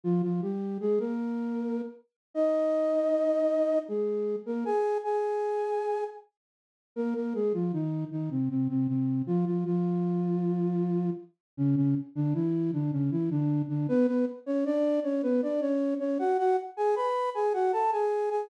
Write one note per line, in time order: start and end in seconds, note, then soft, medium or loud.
0.03 0.22 F3 medium
0.03 0.22 F4 loud
0.22 0.41 F3 medium
0.22 0.41 F4 medium
0.42 0.78 G3 medium
0.42 0.78 G4 medium
0.80 0.99 G#3 medium
0.80 0.99 G#4 loud
0.99 1.81 A#3 medium
0.99 1.81 A#4 medium
2.34 3.79 D#4 medium
2.34 3.79 D#5 loud
3.88 4.36 G#3 medium
3.88 4.36 G#4 medium
4.46 4.64 A#3 medium
4.46 4.64 A#4 medium
4.65 4.98 G#4 medium
4.65 4.98 G#5 loud
5.04 6.04 G#4 medium
5.04 6.04 G#5 medium
6.96 7.14 A#3 medium
6.96 7.14 A#4 loud
7.15 7.33 A#3 medium
7.15 7.33 A#4 medium
7.34 7.53 G#3 medium
7.34 7.53 G#4 medium
7.54 7.72 F3 medium
7.54 7.72 F4 medium
7.73 8.04 D#3 medium
7.73 8.04 D#4 medium
8.11 8.29 D#3 medium
8.11 8.29 D#4 medium
8.30 8.49 C3 medium
8.30 8.49 C4 medium
8.50 8.68 C3 medium
8.50 8.68 C4 medium
8.69 8.87 C3 medium
8.69 8.87 C4 medium
8.88 9.22 C3 medium
8.88 9.22 C4 medium
9.27 9.45 F3 medium
9.27 9.45 F4 loud
9.46 9.64 F3 medium
9.46 9.64 F4 medium
9.65 11.10 F3 medium
9.65 11.10 F4 medium
11.57 11.75 C#3 loud
11.57 11.75 C#4 loud
11.76 11.95 C#3 medium
11.76 11.95 C#4 loud
12.15 12.33 D3 loud
12.15 12.33 D4 loud
12.34 12.71 E3 medium
12.34 12.71 E4 loud
12.73 12.91 D3 medium
12.73 12.91 D4 medium
12.92 13.10 C#3 medium
12.92 13.10 C#4 medium
13.11 13.29 E3 medium
13.11 13.29 E4 medium
13.30 13.62 D3 medium
13.30 13.62 D4 loud
13.68 13.87 D3 medium
13.68 13.87 D4 loud
13.88 14.06 B3 loud
13.88 14.06 B4 loud
14.07 14.25 B3 medium
14.07 14.25 B4 loud
14.46 14.64 C#4 medium
14.46 14.64 C#5 loud
14.65 15.00 D4 loud
14.65 15.00 D5 loud
15.04 15.22 C#4 medium
15.04 15.22 C#5 loud
15.23 15.41 B3 medium
15.23 15.41 B4 loud
15.42 15.61 D4 medium
15.42 15.61 D5 medium
15.61 15.94 C#4 medium
15.61 15.94 C#5 loud
15.99 16.18 C#4 medium
15.99 16.18 C#5 loud
16.19 16.37 F#4 medium
16.19 16.37 F#5 loud
16.38 16.56 F#4 loud
16.38 16.56 F#5 loud
16.77 16.95 G#4 medium
16.77 16.95 G#5 loud
16.96 17.30 B4 medium
16.96 17.30 B5 loud
17.35 17.53 G#4 medium
17.35 17.53 G#5 loud
17.54 17.72 F#4 medium
17.54 17.72 F#5 loud
17.73 17.91 A4 medium
17.73 17.91 A5 loud
17.92 18.29 G#4 medium
17.92 18.29 G#5 medium
18.30 18.49 G#4 medium
18.30 18.49 G#5 loud